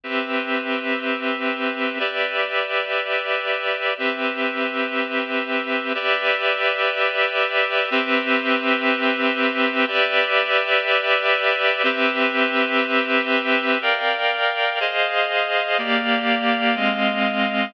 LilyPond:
\new Staff { \time 4/4 \key g \mixolydian \tempo 4 = 122 <c' g' b' e''>1 | <g' b' d'' e''>1 | <c' g' b' e''>1 | <g' b' d'' e''>1 |
<c' g' b' e''>1 | <g' b' d'' e''>1 | <c' g' b' e''>1 | \key bes \mixolydian <bes' d'' f'' g''>2 <aes' c'' ees'' f''>2 |
<bes g' d'' f''>2 <aes c' ees'' f''>2 | }